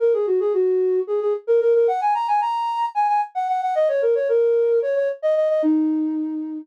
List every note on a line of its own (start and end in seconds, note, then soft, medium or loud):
0.00 0.13 A#4 medium
0.13 0.26 G#4 medium
0.27 0.39 F#4 medium
0.40 0.53 G#4 medium
0.54 1.00 F#4 medium
1.07 1.20 G#4 medium
1.21 1.33 G#4 medium
1.47 1.60 A#4 medium
1.61 1.73 A#4 loud
1.74 1.87 A#4 medium
1.88 2.00 F#5 loud
2.01 2.14 G#5 medium
2.14 2.27 A#5 medium
2.28 2.40 G#5 medium
2.41 2.86 A#5 medium
2.95 3.07 G#5 medium
3.08 3.21 G#5 medium
3.35 3.48 F#5 medium
3.48 3.61 F#5 medium
3.62 3.75 F#5 medium
3.75 3.88 D#5 loud
3.88 4.01 C#5 medium
4.02 4.15 A#4 medium
4.15 4.28 C#5 medium
4.29 4.79 A#4 medium
4.82 4.95 C#5 medium
4.96 5.08 C#5 medium
5.22 5.35 D#5 medium
5.36 5.49 D#5 medium
5.49 5.62 D#5 medium
5.62 6.58 D#4 loud